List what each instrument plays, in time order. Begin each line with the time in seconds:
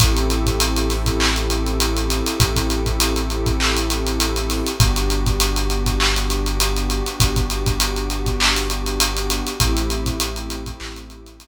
0.00 synth bass 2 A1, pad 2 (warm) C4 E4 G4 A4, kick, closed hi-hat
0.17 closed hi-hat
0.30 closed hi-hat
0.46 kick, closed hi-hat
0.60 closed hi-hat
0.76 closed hi-hat
0.90 snare, closed hi-hat
1.06 kick, closed hi-hat
1.20 clap
1.36 closed hi-hat
1.50 closed hi-hat
1.66 closed hi-hat
1.80 closed hi-hat
1.97 closed hi-hat
2.10 closed hi-hat
2.26 closed hi-hat
2.40 synth bass 2 A1, kick, closed hi-hat
2.56 kick, closed hi-hat
2.70 closed hi-hat
2.86 kick, closed hi-hat
3.00 closed hi-hat
3.16 closed hi-hat
3.30 closed hi-hat
3.46 kick, closed hi-hat
3.60 clap
3.77 closed hi-hat
3.90 closed hi-hat
4.07 closed hi-hat
4.20 closed hi-hat
4.36 closed hi-hat
4.50 snare, closed hi-hat
4.66 closed hi-hat
4.79 synth bass 2 G1, pad 2 (warm) B3 D4 F#4 G4, kick, closed hi-hat
4.96 closed hi-hat
5.10 closed hi-hat
5.26 kick, closed hi-hat
5.40 closed hi-hat
5.56 closed hi-hat
5.70 closed hi-hat
5.86 kick, closed hi-hat
6.00 clap
6.16 closed hi-hat
6.30 closed hi-hat
6.46 closed hi-hat
6.60 closed hi-hat
6.76 closed hi-hat
6.90 closed hi-hat
7.06 closed hi-hat
7.20 synth bass 2 G1, kick, closed hi-hat
7.36 kick, closed hi-hat
7.50 closed hi-hat
7.66 kick, closed hi-hat
7.80 closed hi-hat
7.96 closed hi-hat
8.10 closed hi-hat
8.26 kick, closed hi-hat
8.40 clap
8.56 snare, closed hi-hat
8.70 closed hi-hat
8.86 closed hi-hat
9.00 closed hi-hat
9.17 closed hi-hat
9.30 closed hi-hat
9.47 closed hi-hat
9.60 synth bass 2 A1, pad 2 (warm) A3 C4 E4 G4, kick, closed hi-hat
9.77 closed hi-hat
9.90 closed hi-hat
10.06 kick, closed hi-hat
10.20 closed hi-hat
10.36 closed hi-hat
10.50 closed hi-hat
10.66 kick, closed hi-hat
10.80 synth bass 2 A1, clap
10.96 closed hi-hat
11.10 closed hi-hat
11.26 closed hi-hat
11.40 closed hi-hat